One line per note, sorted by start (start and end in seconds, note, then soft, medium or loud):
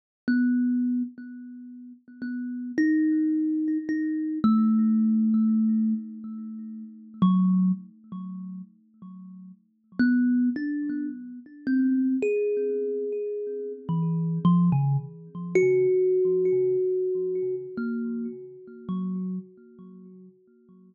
0.28 1.03 B3 medium
2.22 2.72 B3 medium
2.78 3.78 D#4 loud
3.89 4.39 D#4 medium
4.44 5.94 A3 loud
7.22 7.72 F#3 loud
10.00 10.50 B3 loud
10.56 11.06 D4 medium
11.67 12.17 C4 medium
12.22 13.72 G#4 medium
13.89 14.39 E3 medium
14.45 14.70 F3 loud
14.72 14.97 C#3 loud
15.55 17.55 F#4 loud
17.77 18.27 A#3 medium
18.89 19.39 F#3 medium